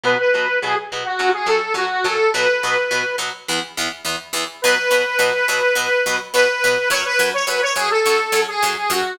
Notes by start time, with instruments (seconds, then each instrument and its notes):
0.04 acoustic guitar (steel) B2 F#3 B3, lead 1 (square) B4
0.19 lead 1 (square) B4
0.34 acoustic guitar (steel) B2 F#3 B3
0.62 acoustic guitar (steel) B2 F#3 B3, lead 1 (square) G#4
0.92 acoustic guitar (steel) B2 F#3 B3
1.05 lead 1 (square) F#4
1.19 acoustic guitar (steel) F#2 F#3 C#4
1.33 lead 1 (square) G#4
1.46 acoustic guitar (steel) F#2 F#3 C#4, lead 1 (square) A4
1.74 acoustic guitar (steel) F#2 F#3 C#4, lead 1 (square) F#4
2.04 acoustic guitar (steel) F#2 F#3 C#4, lead 1 (square) A4
2.33 acoustic guitar (steel) B2 F#3 B3, lead 1 (square) B4
2.63 acoustic guitar (steel) B2 F#3 B3
2.91 acoustic guitar (steel) B2 F#3 B3
3.18 acoustic guitar (steel) B2 F#3 B3
3.48 acoustic guitar (steel) E2 E3 B3
3.77 acoustic guitar (steel) E2 E3 B3
4.05 acoustic guitar (steel) E2 E3 B3
4.33 acoustic guitar (steel) E2 E3 B3
4.62 acoustic guitar (steel) B2 F#3 B3, lead 1 (square) B4
4.91 acoustic guitar (steel) B2 F#3 B3
5.19 acoustic guitar (steel) B2 F#3 B3
5.48 acoustic guitar (steel) B2 F#3 B3
5.75 acoustic guitar (steel) B2 F#3 B3
6.06 acoustic guitar (steel) B2 F#3 B3
6.33 acoustic guitar (steel) B2 F#3 B3, lead 1 (square) B4
6.64 acoustic guitar (steel) B2 F#3 B3
6.90 acoustic guitar (steel) F#2 F#3 C#4, lead 1 (square) C#5
7.05 lead 1 (square) B4
7.19 acoustic guitar (steel) F#2 F#3 C#4
7.33 lead 1 (square) C#5
7.47 acoustic guitar (steel) F#2 F#3 C#4, lead 1 (square) B4
7.62 lead 1 (square) C#5
7.76 acoustic guitar (steel) F#2 F#3 C#4, lead 1 (square) G#4
7.91 lead 1 (square) A4
8.06 acoustic guitar (steel) F#2 F#3 C#4
8.32 acoustic guitar (steel) F#2 F#3 C#4
8.48 lead 1 (square) G#4
8.63 acoustic guitar (steel) F#2 F#3 C#4
8.90 acoustic guitar (steel) F#2 F#3 C#4, lead 1 (square) F#4